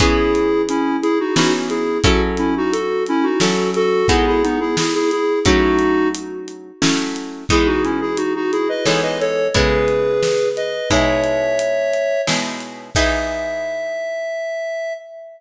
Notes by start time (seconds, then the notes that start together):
0.00 E3 B3 C#4 E4 G#4, kick, closed hi-hat
0.35 closed hi-hat
0.69 C#4 E4, closed hi-hat
1.02 E4 G#4, closed hi-hat
1.20 D#4 F#4
1.36 E3 B3 C#4 D#4 F#4 G#4, snare
1.69 E4 G#4, closed hi-hat
2.04 F#3 C#4 E4 F#4 A4, kick, closed hi-hat
2.37 C#4 E4, closed hi-hat
2.57 D#4 F#4
2.72 F#4 A4, closed hi-hat
3.06 C#4 E4, closed hi-hat
3.23 D#4 F#4
3.40 F#3 C#4 E4 F#4 A4, snare
3.74 F#4 A4, closed hi-hat
4.08 G#3 B3 D#4 E4 F#4 G#4, kick, closed hi-hat
4.27 E4 G#4
4.43 B3 D#4, closed hi-hat
4.60 E4 G#4
4.77 E4 G#4, snare
4.94 E4 G#4
5.11 E4 G#4, closed hi-hat
5.45 F#3 A3 C#4 D#4 E4 F#4, kick, closed hi-hat
5.79 closed hi-hat
6.14 closed hi-hat
6.48 closed hi-hat
6.82 F#3 A3 C#4 E4, snare
7.16 closed hi-hat
7.49 E3 G#3 B3 D#4 E4 G#4, kick, closed hi-hat
7.66 D#4 F#4
7.84 C#4 E4, closed hi-hat
8.01 E4 G#4
8.17 D#4 F#4, closed hi-hat
8.35 D#4 F#4
8.52 E4 G#4, closed hi-hat
8.69 B4 D#5
8.85 E3 G#3 B3 D#4 A4 C#5, snare
9.03 B4 D#5
9.20 A4 C#5, closed hi-hat
9.54 C#3 G#3 B3 E4 G#4 B4, kick, closed hi-hat
9.88 closed hi-hat
10.23 snare
10.57 B4 D#5, closed hi-hat
10.90 B2 G#3 D#4 E4 C#5 E5, kick, closed hi-hat
11.24 closed hi-hat
11.59 closed hi-hat
11.93 closed hi-hat
12.27 B2 G#3 D#4 E4, snare
12.60 closed hi-hat
12.95 E3 B3 D#4 G#4 E5, kick, crash